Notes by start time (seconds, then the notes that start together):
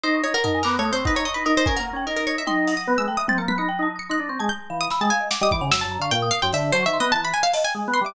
0.03 D#4 C5 D#6
0.14 C#6
0.24 D#4 C#5
0.34 A#4 F#5
0.44 D#4 A#4 A5, floor tom
0.54 G#5
0.63 B3 A#4 D6, clap
0.74 D#6
0.79 A3 C#5
0.85 D#6
0.92 C4 C5 C#6
1.05 D#4 B4 F#5, kick
1.15 D#4 C#5 A#5
1.25 D#5 C#6, cowbell
1.34 D#4 B4
1.45 D#4 A#4 D#6
1.56 D#4 C5
1.66 C#4 A#4 G#5, kick
1.76 A#3 A#4 F#5
1.93 C#4 G5
2.06 D#4 A#4 D#5
2.16 A#4
2.27 C#5
2.38 E5
2.47 D#4 G5 C6, high tom
2.67 F#5, closed hi-hat
2.77 D#6
2.87 B3 B4
2.98 G#3 E6
3.08 A3 G5
3.17 E5 D#6
3.28 C4 G5 A6, high tom
3.38 A#3 A#5 C#7
3.48 B3 B6, high tom
3.58 D#4 B5 C#7
3.69 G5
3.79 D#4 A5
3.96 D#6 C#7
4.09 D#4 C6 F#6
4.19 D4
4.29 C4 C#6
4.39 G#3 A5 G#6
4.49 G6
4.70 E3 F5
4.81 D#6
4.90 B5 E6, snare
5.01 G#3 G5 A5
5.10 F5 G#5
5.20 D#5
5.31 F#5 D6, snare
5.41 G3 D#5 D#6
5.51 E3 D6, kick
5.61 C#3 F#5
5.71 F#2 E6, snare
5.81 A5
5.85 F#2
5.92 A#5
5.99 D3 F5 C#6
6.11 A#2 G5
6.22 D#6
6.31 F5 D#6
6.42 F#2 G5 C6
6.53 D3 E5, closed hi-hat
6.72 F#3 C5 A5, cowbell
6.83 D#3 E5 C#6
6.93 C6
7.00 B3 D#5
7.12 E3 A5 A#5
7.24 B5
7.34 G#5
7.43 F5
7.53 D#5 A5, closed hi-hat
7.64 G5 G#5
7.75 G#3
7.88 B3
7.93 B5 C6
8.01 G3 E5
8.06 D6